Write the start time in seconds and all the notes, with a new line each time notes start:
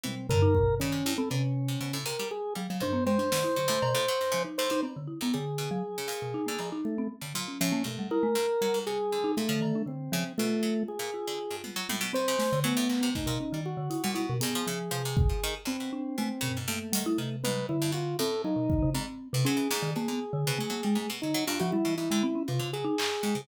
0.03 B2 E3 C4, high tom
0.29 D3 A#4, floor tom
0.42 D#4
0.55 B2, kick
0.80 C#3 D#3 C#4
0.92 C3
1.06 G2 E4
1.18 C4 A4
1.30 C3 D3 C#4, cowbell
1.68 C3
1.81 B2 C#3
1.93 A2
2.06 C3 A#4, closed hi-hat
2.19 G3
2.31 G#4
2.55 F#3 G3
2.70 C#3 F#3
2.80 D#3 D4 C5, floor tom
2.93 B3
3.06 B2 G#3 C5
3.18 F3 D4
3.32 B2 D#3, snare
3.44 E4
3.56 D3 F#3
3.68 A2 A3
3.82 B2, cowbell
3.95 A2
4.08 F#3
4.21 G2
4.32 C#3 F3
4.45 D#4
4.58 A2 C5
4.70 B2 D#4
4.83 C4, cowbell
4.96 D3
5.07 E4
5.21 A2 B3
5.34 D3 G3 G#4
5.58 B2
5.71 F#3
5.98 C#3
6.08 A#2, closed hi-hat
6.22 B2
6.34 D#4
6.46 D3 A#3
6.58 A2 F3, cowbell
6.72 D#4
6.85 A3
6.98 C4
7.21 G2 D3
7.34 A#2 F#3
7.48 C#4
7.61 A2 F3 C#4
7.72 A#3
7.84 G2 B2 A3
7.99 G3
8.11 E4 A#4
8.23 A3
8.35 G2
8.61 F#3 G3
8.74 G#2
8.87 C3 G#4
9.12 D3
9.24 D#4
9.37 A#2 A3
9.49 D3 F3
9.61 D#3, cowbell
9.75 D4
9.86 D3 C4
10.12 C#3 F3
10.38 B2 A3 F4
10.63 F#3
10.88 G#4
10.99 A#2
11.14 F4
11.27 D3
11.51 G2
11.64 B2, high tom
11.76 F#3
11.89 A2, high tom
12.01 B2
12.13 B2 C4 C5
12.28 C#3
12.39 A3, snare
12.52 C3 D3
12.64 F#3 A3 B3
12.77 A2
12.89 A#2, clap
13.01 C3 B3
13.15 G2 A3 D#4, kick
13.26 A#2 B2
13.40 C#4
13.52 D#3 G3
13.66 F#4
13.77 D3
13.90 E4, closed hi-hat
14.04 A#2 G3
14.15 B2 E4
14.29 B2
14.41 G2 B3 G#4, closed hi-hat
14.55 F3
14.67 C#3 F3
14.91 C3 F3
15.05 C3
15.17 kick
15.29 F3
15.43 D#3
15.65 G2 C4
15.80 B2
15.93 D4
16.18 B2 A3
16.41 B2 C#3, floor tom
16.57 G#2
16.68 G2 A3 A#3
16.93 D#3 G3, closed hi-hat
17.06 E4
17.18 C3 D#3
17.44 G#2 B4, high tom
17.69 D3 E4
17.82 G2
17.92 B2 F4
18.19 A2 C4 A4, closed hi-hat
18.44 F#3 D#4
18.56 B2
18.69 D#3, kick
18.82 C#3
18.94 G#2 C4, cowbell
19.33 A2 C3
19.45 F#3 C#4 G#4
19.57 E3
19.71 G#2, snare
19.82 D#3
19.96 B2 A#3 G#4
20.08 D3 B3
20.33 D3
20.47 B2 C#3
20.59 F#3 A3
20.70 F#3 A#3
20.83 G3 G#3
20.95 G#2 A3
21.10 B2
21.22 D3 F#3 D#4
21.34 F#3
21.47 G2 D4 F4, cowbell
21.59 C#3 F3 F#4
21.72 G3 E4
21.85 B2 E3
21.97 G#2 E4
22.11 D3 G#3
22.23 C4
22.35 C#4
22.48 A2 C3 F4
22.59 C#3 D3
22.73 F#3 G#4
22.85 D#4
22.98 G2, clap
23.23 G#2 G#3
23.35 A2 C#3